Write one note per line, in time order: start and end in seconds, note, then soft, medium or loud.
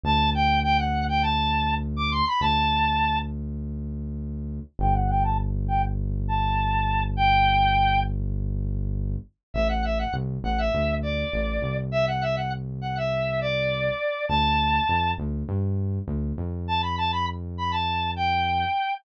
0.04 2.22 D2 medium
0.04 0.30 A5 loud
0.34 0.60 G5 loud
0.63 0.77 G5 loud
0.78 1.04 F#5 loud
1.09 1.23 G5 loud
1.22 1.75 A5 loud
1.96 2.11 D6 loud
2.11 2.25 C6 loud
2.27 2.41 B5 loud
2.41 4.60 D2 medium
2.41 3.19 A5 loud
4.79 9.16 G1 medium
4.79 4.94 G5 loud
4.94 5.08 F#5 loud
5.09 5.24 G5 loud
5.24 5.38 A5 loud
5.68 5.82 G5 loud
6.28 7.03 A5 loud
7.17 8.00 G5 loud
9.54 10.05 A1 medium
9.54 9.68 E5 loud
9.69 9.83 F#5 medium
9.84 9.99 E5 medium
9.99 10.13 F#5 medium
10.13 10.38 C2 medium
10.44 10.69 A1 medium
10.44 10.58 F#5 loud
10.58 10.95 E5 medium
10.74 11.24 D2 medium
11.02 11.77 D5 medium
11.33 11.59 A1 medium
11.62 13.90 C2 medium
11.92 12.06 E5 loud
12.07 12.22 F#5 loud
12.22 12.36 E5 loud
12.36 12.50 F#5 medium
12.82 12.96 F#5 medium
12.97 13.40 E5 medium
13.41 14.26 D5 loud
14.29 14.80 D2 medium
14.29 15.12 A5 loud
14.89 15.14 F2 medium
15.18 15.44 D2 medium
15.49 15.99 G2 medium
16.08 16.33 D2 medium
16.38 18.65 F2 medium
16.68 16.82 A5 loud
16.82 16.96 B5 medium
16.98 17.12 A5 loud
17.12 17.26 B5 loud
17.58 17.72 B5 loud
17.71 18.11 A5 medium
18.16 18.94 G5 medium